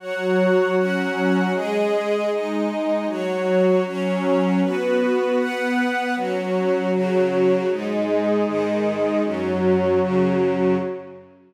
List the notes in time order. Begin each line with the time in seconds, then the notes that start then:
0.00 F#3 F#4 C#5 F#5
0.76 F#3 C#4 F#4 C#5 F#5
1.53 G#3 G#4 D#5
2.29 G#3 D#4 D#5
3.06 F#3 F#4 C#5
3.84 F#3 C#4 C#5
4.62 B3 F#4 B4
5.38 B3 B4 F#5
6.14 F#3 C#4 F#4 C#5
6.92 C#3 F#3 F#4
7.69 G#2 G#3 D#4 G#4 D#5
8.46 G#2 D#3 D#4
9.23 F#2 F#3 C#4 F#4 C#5
10.00 F#2 C#3 C#4